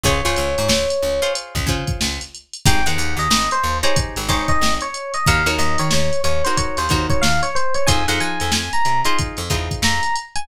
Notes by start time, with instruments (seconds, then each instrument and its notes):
0.04 electric bass (finger) C#2, acoustic guitar (steel) F4 G#4 C5 C#5, electric piano 1 C#5, kick, closed hi-hat
0.25 electric bass (finger) C#2, acoustic guitar (steel) F4 G#4 C5 C#5, closed hi-hat
0.36 electric bass (finger) C#2, closed hi-hat
0.58 electric bass (finger) G#2, closed hi-hat
0.68 electric bass (finger) C#2, snare
0.90 closed hi-hat
1.03 electric bass (finger) C#2, snare
1.22 acoustic guitar (steel) F4 G#4 C5 C#5, closed hi-hat
1.35 closed hi-hat
1.55 electric bass (finger) C#2, kick, closed hi-hat
1.67 electric bass (finger) C#3, acoustic guitar (steel) F4 G#4 C5 C#5, kick, closed hi-hat
1.87 kick, closed hi-hat
2.01 electric bass (finger) C#2, snare
2.20 snare, closed hi-hat
2.35 closed hi-hat
2.54 closed hi-hat
2.66 electric bass (finger) G#1, acoustic guitar (steel) D#4 G4 G#4 C5, electric piano 1 G5, kick, closed hi-hat
2.86 electric bass (finger) D#2, acoustic guitar (steel) D#4 G4 G#4 C5, electric piano 1 F#5, closed hi-hat
2.98 electric bass (finger) D#2, closed hi-hat
3.17 electric bass (finger) D#2, electric piano 1 D#5, closed hi-hat
3.30 electric bass (finger) G#1, snare
3.51 electric piano 1 C5, closed hi-hat
3.63 electric bass (finger) D#2
3.83 acoustic guitar (steel) D#4 G4 G#4 C5, electric piano 1 C#5, closed hi-hat
3.96 kick, closed hi-hat
4.16 electric bass (finger) G#1, closed hi-hat
4.28 electric bass (finger) G#1, acoustic guitar (steel) D#4 G4 G#4 C5, electric piano 1 C#5, kick, closed hi-hat
4.48 electric piano 1 D#5, kick, snare, closed hi-hat
4.61 electric bass (finger) G#1, snare
4.81 electric piano 1 C#5, closed hi-hat
4.94 closed hi-hat
5.14 electric piano 1 D#5, closed hi-hat
5.26 electric bass (finger) D#2, acoustic guitar (steel) D#4 F#4 A#4 C#5, electric piano 1 F5, kick, closed hi-hat
5.46 electric bass (finger) D#2, acoustic guitar (steel) D#4 F#4 A#4 C#5, closed hi-hat
5.58 electric bass (finger) D#2, electric piano 1 D#5, closed hi-hat
5.78 electric bass (finger) D#3, electric piano 1 C#5, closed hi-hat
5.91 electric bass (finger) D#2, electric piano 1 C#5, snare
6.13 closed hi-hat
6.24 electric bass (finger) D#2, electric piano 1 C#5, closed hi-hat
6.44 acoustic guitar (steel) D#4 F#4 A#4 C#5, electric piano 1 C5, snare, closed hi-hat
6.57 electric piano 1 C#5, kick, closed hi-hat
6.77 electric bass (finger) D#2, electric piano 1 C5, closed hi-hat
6.89 electric bass (finger) D#2, acoustic guitar (steel) D#4 F#4 A#4 C#5, kick, closed hi-hat
7.10 electric piano 1 C#5, kick, closed hi-hat
7.22 electric bass (finger) D#2, electric piano 1 F5, snare
7.43 electric piano 1 C#5, closed hi-hat
7.55 electric piano 1 C5, closed hi-hat
7.74 electric piano 1 C#5, closed hi-hat
7.87 electric bass (finger) F2, acoustic guitar (steel) D#4 F4 G#4 C5, electric piano 1 G#5, kick, closed hi-hat
8.08 electric bass (finger) F2, acoustic guitar (steel) D#4 F4 G#4 C5, electric piano 1 F#5, closed hi-hat
8.20 electric bass (finger) F3, electric piano 1 G#5, closed hi-hat
8.40 electric bass (finger) F2, closed hi-hat
8.51 electric bass (finger) F2, electric piano 1 G#5, snare
8.73 electric piano 1 A#5, closed hi-hat
8.85 electric bass (finger) C3, closed hi-hat
9.05 acoustic guitar (steel) D#4 F4 G#4 C5, electric piano 1 C6, closed hi-hat
9.19 kick, closed hi-hat
9.37 electric bass (finger) F2, closed hi-hat
9.50 electric bass (finger) E2, acoustic guitar (steel) D#4 F4 G#4 C5, kick, closed hi-hat
9.71 kick, closed hi-hat
9.82 electric bass (finger) F2, electric piano 1 A#5, snare
10.03 closed hi-hat
10.16 closed hi-hat
10.36 electric piano 1 G#5, closed hi-hat